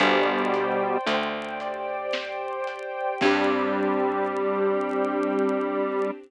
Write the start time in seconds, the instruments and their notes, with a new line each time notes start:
0.00 electric bass (finger) G1, lead 1 (square) B2 G3, string ensemble 1 C5 D5 G5, acoustic grand piano C5, kick, closed hi-hat
0.54 acoustic grand piano G5, closed hi-hat
1.06 electric bass (finger) D2, acoustic grand piano C5, closed hi-hat
1.60 string ensemble 1 G4 C5 G5, acoustic grand piano D5, closed hi-hat
2.13 acoustic grand piano C5, snare
2.67 acoustic grand piano G5, closed hi-hat
3.21 electric bass (finger) G2, lead 1 (square) G3, acoustic grand piano C4 D4, string ensemble 1 C4 D4 G4, kick, crash
3.25 acoustic grand piano G4